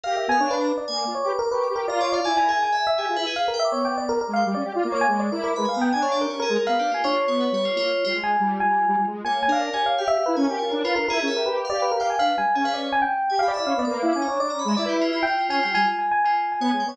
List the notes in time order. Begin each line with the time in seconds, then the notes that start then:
0.04 G4 A#4 F5
0.16 G4 E5
0.28 B3 F5 G#5
0.39 D4 C#5 F5
0.51 B4 D5
0.61 A#5
0.78 D5
0.88 A#3 G#5
0.97 D6
1.07 F4
1.15 C#5
1.24 G4 B4 D6
1.39 A#4 D6
1.51 G4 B4 C#6
1.61 B4 D6
1.70 G4
1.76 A#4
1.87 F4 D5 A#5
2.01 C#5 D5
2.12 D5 F5
2.24 E4 D5 G#5
2.37 A#4 G#5
2.49 G#4 G#5
2.63 D5 G#5
2.72 E5 G#5
2.87 E5
2.98 G4 G#4 G#5
3.09 F4
3.16 E4 B4
3.27 G#4
3.36 B4 F5
3.48 A#4
3.54 G5
3.60 E5
3.65 D6
3.72 B3 C#5 D6
3.85 G5 D6
3.98 D5 D6
4.09 A#4 D6
4.21 A#4
4.28 G#3
4.34 F5 G5
4.46 G3 D6
4.55 C#4 D5
4.64 G4
4.74 F4 D5
4.83 A#3 D6
4.92 C#5 D6
5.01 G#5
5.07 G#3 C#5 D6
5.19 D5 D6
5.32 E4 A#4 D6
5.44 A#4 D6
5.56 G#3 B4 B5
5.65 F5 G#5
5.74 B3 A#5
5.81 G5
5.92 D4 G#5
6.02 C#5 F5
6.12 D5
6.21 G4 A#4
6.29 C#4 C#5
6.40 G#4 A#4
6.49 G#3
6.56 A#4
6.67 B3 B4 F5
6.79 D4 G4
6.91 A#3 F4 G#5
7.04 D4 F4 C#5
7.15 F4
7.27 B3 C#5
7.40 B4
7.52 G3 C#5
7.65 F4
7.75 A#3 F4
8.05 G3 F4
8.14 G#3 F4
8.23 G#5
8.40 G3
8.60 G3 G#5
8.88 G3
8.98 G3
9.07 G#3
9.24 A#3 C#5 G#5
9.43 G#5
9.48 D4 A#4
9.52 F5
9.61 D5
9.73 G4 C#5 G#5
9.86 F5
9.98 G4 F5 G5
10.08 G4 E5
10.18 G4
10.26 E4 B4
10.35 C#4 A#4 G#5
10.44 G4 A#4
10.59 F4 C#5
10.72 D4 A#4
10.84 F4 B4
10.96 D4 A#4
11.08 E4 G#4 A#4
11.18 C#4 A#4
11.28 E5
11.34 G4 A#4
11.46 G4 B4
11.57 B4
11.65 F5
11.70 G4 D5
11.82 B4
11.91 G4 A#4
12.00 F5 G5
12.10 G#5
12.19 D4 B4 F5
12.37 G3 G#5
12.55 C#4 G#4 G#5
12.64 B4 F5
12.74 C#5 D5
12.92 G#5
13.02 G5
13.30 G4 G#5
13.39 G4 F5 B5
13.48 D5
13.54 E4 D5 E5
13.65 C#4 F5 B5
13.77 B3 D5
13.85 A#3 D6
13.91 B4
14.02 E4 F5
14.13 C#4 G#5 D6
14.22 A#5
14.27 D4 C#5
14.40 D4 D5 D6
14.50 C#4 A#5
14.59 B5
14.65 G#3 E5
14.77 E4 D5
14.86 G4 B4
15.01 F4
15.13 F4
15.23 G5
15.27 F4
15.39 F4
15.49 C#4 F4 G#5
15.63 G3 F4 G5
15.74 G3 F4 G#5
15.86 F4 G#5
15.99 G#5
16.11 G#5
16.24 F4 G#5
16.34 G#5
16.52 G#5
16.60 B3 C#5
16.69 G#3 G#5
16.80 G5
16.85 B3 C#5 G#5